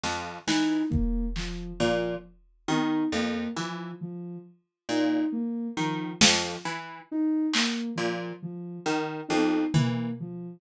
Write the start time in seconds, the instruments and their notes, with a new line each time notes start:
0.03 pizzicato strings F2, snare
0.47 pizzicato strings E3, ocarina D#4, snare
0.90 ocarina A#3, kick
1.36 ocarina F3, clap
1.80 pizzicato strings A#2, ocarina F3, cowbell
2.68 pizzicato strings D#3, ocarina D#4, high tom
3.12 pizzicato strings F2, ocarina A#3
3.56 pizzicato strings E3, ocarina F3
4.01 ocarina F3
4.89 pizzicato strings A#2, ocarina D#4
5.32 ocarina A#3
5.77 pizzicato strings D#3, ocarina F3
6.21 pizzicato strings F2, ocarina F3, snare
6.65 pizzicato strings E3
7.11 ocarina D#4
7.53 ocarina A#3, clap
7.96 pizzicato strings A#2, ocarina F3
8.42 ocarina F3
8.86 pizzicato strings D#3
9.28 pizzicato strings F2, ocarina D#4, high tom
9.74 pizzicato strings E3, ocarina A#3, floor tom
10.20 ocarina F3